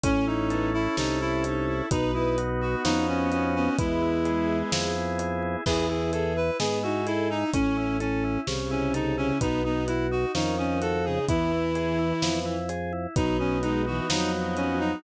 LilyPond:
<<
  \new Staff \with { instrumentName = "Clarinet" } { \time 2/2 \key e \major \tempo 2 = 64 cis'8 dis'4 e'8 dis'8 e'8 r4 | dis'8 e'8 r8 fis'8 dis'8 cis'8 cis'8 cis'8 | e'2 r2 | gis'8 gis'8 a'8 b'8 gis'8 fis'8 e'8 dis'8 |
cis'4 cis'4 r8 cis'8 dis'8 cis'8 | dis'8 dis'8 e'8 fis'8 dis'8 cis'8 a'8 gis'8 | e'2~ e'8 r4. | \key b \major dis'8 cis'8 dis'8 fis'8 dis'8 r8 cis'8 dis'8 | }
  \new Staff \with { instrumentName = "Violin" } { \time 2/2 \key e \major cis'8 cis'8 b8 r4. dis'8 e'8 | b'8 b'8 r4 b4. b8 | gis2~ gis8 r4. | e'8 e'8 gis'8 r8 b8 dis'8 a'8 dis'8 |
cis'8 cis'8 r4 cis4. cis8 | b8 b8 r4 dis4. cis8 | e2. r4 | \key b \major fis8 fis8 gis8 e8 fis2 | }
  \new Staff \with { instrumentName = "Drawbar Organ" } { \time 2/2 \key e \major cis'8 e'8 a'8 e'8 cis'8 e'8 a'8 e'8 | b8 dis'8 fis'8 dis'8 cis'8 dis'8 fis'8 dis'8 | b8 e'8 gis'8 e'8 b8 e'8 gis'8 e'8 | b8 e'8 gis'8 e'8 b8 e'8 gis'8 e'8 |
cis'8 e'8 a'8 e'8 cis'8 e'8 a'8 e'8 | b8 dis'8 fis'8 dis'8 cis'8 dis'8 fis'8 dis'8 | b8 e'8 gis'8 e'8 b8 e'8 gis'8 e'8 | \key b \major b8 dis'8 fis'8 dis'8 b8 dis'8 fis'8 dis'8 | }
  \new Staff \with { instrumentName = "Drawbar Organ" } { \clef bass \time 2/2 \key e \major a,,2 c,2 | b,,2 f,2 | e,2 f,2 | e,2 gis,2 |
a,,2 c,2 | b,,2 f,2 | e,2 f,2 | \key b \major b,,2 f,2 | }
  \new DrumStaff \with { instrumentName = "Drums" } \drummode { \time 2/2 <hh bd>4 hh4 sn4 hh4 | <hh bd>4 hh4 sn4 hh4 | <hh bd>4 hh4 sn4 hh4 | <cymc bd>4 hh4 sn4 hh4 |
<hh bd>4 hh4 sn4 hh4 | <hh bd>4 hh4 sn4 hh4 | <hh bd>4 hh4 sn4 hh4 | <hh bd>4 hh4 sn4 hh4 | }
>>